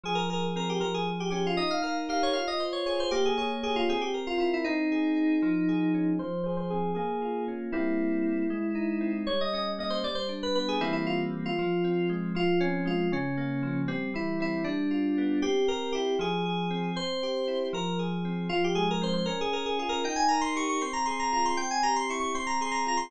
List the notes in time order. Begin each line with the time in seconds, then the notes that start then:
0.04 F3 G#4
0.15 A#4
0.29 G#4 A#4
0.56 C4 A#4
0.69 G4
0.80 F3 A#4
0.94 G#4
1.07 G#4
1.20 G4
1.30 C#4 G4
1.46 F4
1.57 D#4 D#5
1.71 F5
1.82 A#4 F5
2.09 G4 F5
2.23 C#5
2.33 F4 F5
2.48 D#5
2.60 C5
2.73 C#5
2.86 G#4 C#5
3.00 C5
3.11 A#3 G4
3.25 G#4
3.37 G#4 C#5
3.63 G4 G#4
3.76 F4
3.89 C4 G#4
4.01 G4
4.14 A#4
4.27 F4
4.38 E4 F4
4.54 E4
4.64 C4 D#4
4.92 G#4
5.16 D#4
5.42 F3
5.68 G#4
5.94 C#4
6.19 F3 C5
6.44 G#4 C5
6.57 C5
6.70 C4 G#4
6.95 A#3 G#4
7.22 F4
7.48 C#4
7.72 G3 A#3 C4 E4
8.50 G#3
8.75 D#4
9.01 C4
9.27 G3 C#5
9.41 D#5
9.53 C#4 D#5
9.78 A#3 D#5
9.90 C5
10.04 G3 D5
10.15 C5
10.29 D4
10.43 B4
10.55 B3 B4
10.68 G#4
10.81 E3 G3 A#3 C4 E4
10.93 E4
11.07 F4
11.46 F4
11.59 F3
11.84 C4
12.09 G#3
12.35 F3 F4
12.60 C4 C#4
12.85 G#3 F4
13.12 C#3 C#4
13.37 A#3
13.63 F3
13.88 G3 C4
14.14 E3 E4
14.40 C4 E4
14.64 G3 D4
14.91 F4
15.18 B3
15.42 C4 G4
15.68 G4 A#4
15.92 E4 G4
16.19 F3 G#4
16.45 G#4
16.70 C4
16.96 C4 C5
17.23 G4
17.48 E4
17.73 F3 A#4
17.99 G#4
18.25 C4
18.49 F3 F4
18.64 G4
18.75 G#3 G#4
18.91 A#4
19.01 C4 C5
19.13 C5
19.26 C#4 A#4
19.41 G#4
19.52 G#4 A#4
19.66 G#4
19.79 F4 G#4
19.89 A#4
20.04 D#4 G5
20.16 G#5
20.28 A#4 A#5
20.41 C6
20.55 G4 C#6
20.69 C#6
20.81 C4 C6
20.93 A#5
21.06 G#4 C6
21.19 A#5
21.32 F4 A#5
21.45 C6
21.57 C4 G5
21.71 G#5
21.83 G4 A#5
21.96 C6
22.09 E4 C#6
22.20 C#6
22.35 C4 C6
22.47 A#5
22.61 G#4 C6
22.71 A#5
22.86 F4 A#5
22.97 C6